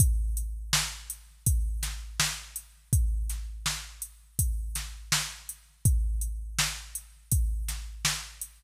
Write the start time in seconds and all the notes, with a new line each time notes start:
0.00 kick, closed hi-hat
0.37 closed hi-hat
0.73 snare
1.10 closed hi-hat
1.46 kick, closed hi-hat
1.83 snare, closed hi-hat
2.20 snare
2.56 closed hi-hat
2.93 kick, closed hi-hat
3.29 snare, closed hi-hat
3.66 snare
4.02 closed hi-hat
4.39 kick, closed hi-hat
4.75 snare, closed hi-hat
5.12 snare
5.49 closed hi-hat
5.85 kick, closed hi-hat
6.21 closed hi-hat
6.59 snare
6.95 closed hi-hat
7.32 kick, closed hi-hat
7.68 snare, closed hi-hat
8.05 snare
8.41 closed hi-hat